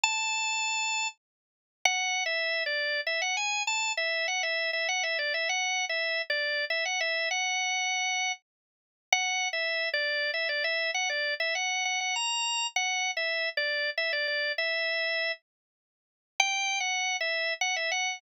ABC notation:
X:1
M:3/4
L:1/16
Q:1/4=99
K:A
V:1 name="Drawbar Organ"
a8 z4 | [K:F#m] (3f4 e4 d4 e f g2 | a2 e2 f e2 e f e d e | (3f4 e4 d4 e f e2 |
f8 z4 | [K:Bm] (3f4 e4 d4 e d e2 | f d2 e f2 f f ^a4 | (3f4 e4 d4 e d d2 |
e6 z6 | (3g4 f4 e4 f e f2 |]